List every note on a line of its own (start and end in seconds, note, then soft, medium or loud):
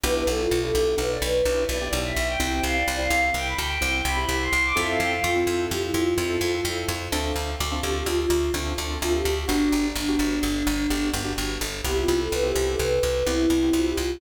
0.03 0.24 B1 loud
0.03 0.42 B3 loud
0.03 0.42 D4 loud
0.03 0.42 E4 loud
0.03 0.42 G4 loud
0.03 0.14 B4 loud
0.14 0.25 B4 medium
0.26 0.47 B1 medium
0.26 0.38 A4 loud
0.39 0.60 F4 medium
0.51 0.71 B1 medium
0.62 1.01 B3 loud
0.62 1.01 D4 loud
0.62 1.01 E4 medium
0.62 1.01 G4 medium
0.62 0.82 A4 loud
0.75 0.95 B1 medium
0.98 1.18 B1 medium
0.98 1.09 B4 medium
1.11 1.22 D5 medium
1.22 1.42 B1 medium
1.22 1.62 B4 loud
1.45 1.65 B1 medium
1.45 1.64 B3 loud
1.45 1.64 D4 loud
1.45 1.64 E4 medium
1.45 1.64 G4 medium
1.69 1.89 B1 medium
1.69 1.79 B3 loud
1.69 1.79 D4 medium
1.69 1.79 E4 loud
1.69 1.79 G4 loud
1.69 1.91 D5 medium
1.81 2.19 B3 medium
1.81 2.19 D4 medium
1.81 2.19 E4 medium
1.81 2.19 G4 loud
1.93 2.13 B1 medium
2.05 2.24 E5 medium
2.16 2.37 B1 medium
2.28 2.39 G5 loud
2.40 2.60 C2 medium
2.40 2.77 C4 loud
2.40 2.77 E4 loud
2.40 2.77 G4 loud
2.40 2.49 G5 loud
2.50 2.61 G5 loud
2.63 2.84 C2 medium
2.63 2.76 F5 medium
2.76 2.97 D5 loud
2.88 3.08 C2 medium
2.99 3.36 C4 loud
2.99 3.36 E4 loud
2.99 3.36 G4 medium
2.99 3.20 F5 medium
3.10 3.31 C2 medium
3.34 3.54 C2 medium
3.34 3.46 G5 loud
3.45 3.56 B5 medium
3.58 3.78 D2 medium
3.58 3.96 G5 medium
3.81 4.02 C2 medium
3.81 4.00 C4 medium
3.81 4.00 E4 loud
3.81 4.00 G4 medium
4.05 4.25 C2 medium
4.05 4.16 C4 medium
4.05 4.16 E4 loud
4.05 4.16 G4 loud
4.05 4.26 B5 loud
4.17 4.55 C4 loud
4.17 4.55 E4 loud
4.17 4.55 G4 loud
4.29 4.49 C2 medium
4.42 4.62 C6 loud
4.53 4.73 C2 medium
4.64 4.76 D6 loud
4.76 4.97 F2 medium
4.76 5.13 C4 loud
4.76 5.13 E4 loud
4.76 5.13 F4 loud
4.76 5.13 A4 loud
4.76 4.88 E5 loud
4.89 5.00 F5 medium
5.00 5.20 F2 medium
5.00 5.11 G5 medium
5.12 5.24 F5 medium
5.23 5.44 F2 medium
5.23 5.63 F4 medium
5.36 5.74 C4 loud
5.36 5.74 E4 loud
5.36 5.74 F4 medium
5.36 5.74 A4 medium
5.47 5.67 F2 medium
5.70 5.91 F2 medium
5.70 5.81 G4 medium
5.82 5.93 E4 medium
5.94 6.14 F2 medium
5.94 6.63 F4 medium
6.18 6.38 F2 medium
6.18 6.37 C4 loud
6.18 6.37 E4 medium
6.18 6.37 F4 medium
6.18 6.37 A4 loud
6.41 6.61 F2 medium
6.41 6.52 C4 medium
6.41 6.52 E4 medium
6.41 6.52 F4 loud
6.41 6.52 A4 medium
6.55 6.92 C4 medium
6.55 6.92 E4 medium
6.55 6.92 F4 medium
6.55 6.92 A4 loud
6.65 6.85 F2 medium
6.88 7.09 F2 medium
7.12 7.32 D2 loud
7.12 7.50 C4 loud
7.12 7.50 D4 loud
7.12 7.50 F4 loud
7.12 7.50 A4 loud
7.36 7.56 D2 medium
7.60 7.80 D2 medium
7.71 8.09 C4 medium
7.71 8.09 D4 medium
7.71 8.09 F4 loud
7.71 8.09 A4 loud
7.82 8.03 D2 medium
7.82 7.93 G4 medium
7.96 8.07 G4 loud
8.06 8.26 D2 medium
8.06 8.17 F4 loud
8.19 8.52 F4 medium
8.30 8.50 D2 medium
8.54 8.74 D2 medium
8.54 8.73 C4 loud
8.54 8.73 D4 loud
8.54 8.73 F4 medium
8.54 8.73 A4 medium
8.78 8.98 D2 medium
8.78 8.88 C4 medium
8.78 8.88 D4 loud
8.78 8.88 F4 medium
8.78 8.88 A4 loud
8.90 9.28 C4 loud
8.90 9.28 D4 medium
8.90 9.28 F4 loud
8.90 9.28 A4 loud
9.01 9.22 D2 medium
9.01 9.12 F4 loud
9.13 9.33 G4 medium
9.25 9.45 D2 medium
9.36 9.47 G4 medium
9.47 9.69 G1 medium
9.47 9.85 B3 loud
9.47 9.86 D4 loud
9.47 9.85 D4 loud
9.47 9.85 F#4 loud
9.47 9.85 G4 loud
9.72 9.92 G1 medium
9.95 10.16 G1 medium
9.95 11.10 D4 medium
10.08 10.46 B3 loud
10.08 10.46 D4 loud
10.08 10.46 F#4 loud
10.08 10.46 G4 loud
10.19 10.39 G1 medium
10.43 10.63 G1 medium
10.67 10.87 G1 medium
10.90 11.10 G1 medium
10.90 11.09 B3 medium
10.90 11.09 D4 loud
10.90 11.09 F#4 loud
10.90 11.09 G4 loud
11.13 11.34 G1 medium
11.13 11.23 B3 loud
11.13 11.23 D4 medium
11.13 11.23 F#4 loud
11.13 11.23 G4 loud
11.25 11.62 B3 loud
11.25 11.62 D4 loud
11.25 11.62 F#4 loud
11.25 11.62 G4 loud
11.38 11.58 G1 medium
11.61 11.81 G1 medium
11.84 12.05 C2 medium
11.84 12.23 B3 loud
11.84 12.23 C4 loud
11.84 12.23 E4 loud
11.84 12.23 G4 loud
11.84 11.97 G4 loud
11.97 12.19 F4 loud
12.08 12.28 C2 medium
12.19 12.30 A4 medium
12.32 12.52 C2 medium
12.32 12.43 B4 loud
12.43 12.81 B3 loud
12.43 12.81 C4 loud
12.43 12.81 E4 medium
12.43 12.81 G4 loud
12.43 12.65 G4 loud
12.56 12.76 C2 medium
12.69 12.80 A4 medium
12.79 12.99 C2 medium
12.79 13.26 B4 medium
13.03 13.23 C2 medium
13.26 13.47 C2 medium
13.26 13.45 B3 loud
13.26 13.45 C4 medium
13.26 13.45 E4 loud
13.26 13.72 E4 loud
13.26 13.45 G4 medium
13.50 13.70 C2 medium
13.50 13.60 B3 medium
13.50 13.60 C4 loud
13.50 13.60 E4 loud
13.50 13.60 G4 loud
13.63 14.00 B3 loud
13.63 14.00 C4 medium
13.63 14.00 E4 medium
13.63 14.00 G4 loud
13.73 13.93 C2 medium
13.73 13.85 F4 medium
13.86 13.97 G4 loud
13.97 14.18 C2 medium
13.97 14.18 F4 medium